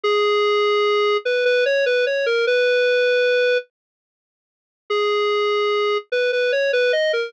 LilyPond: \new Staff { \time 3/4 \key gis \minor \tempo 4 = 74 gis'4. b'16 b'16 cis''16 b'16 cis''16 ais'16 | b'4. r4. | gis'4. b'16 b'16 cis''16 b'16 dis''16 ais'16 | }